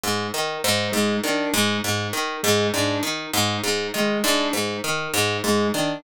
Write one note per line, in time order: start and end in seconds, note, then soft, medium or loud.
0.04 0.28 G#2 medium
0.34 0.58 D#3 medium
0.64 0.88 G#2 medium
0.92 1.17 G#2 medium
0.92 1.16 G#3 medium
1.24 1.48 D#3 medium
1.24 1.49 D4 medium
1.54 1.78 G#2 medium
1.84 2.08 G#2 medium
2.13 2.37 D#3 medium
2.43 2.68 G#2 medium
2.43 2.67 G#3 medium
2.74 2.98 G#2 medium
2.74 2.98 D4 medium
3.03 3.27 D#3 medium
3.33 3.57 G#2 medium
3.64 3.88 G#2 medium
3.94 4.18 D#3 medium
3.94 4.19 G#3 medium
4.24 4.48 G#2 medium
4.24 4.48 D4 medium
4.53 4.77 G#2 medium
4.84 5.08 D#3 medium
5.13 5.38 G#2 medium
5.44 5.68 G#2 medium
5.44 5.68 G#3 medium
5.74 5.98 D#3 medium
5.74 5.99 D4 medium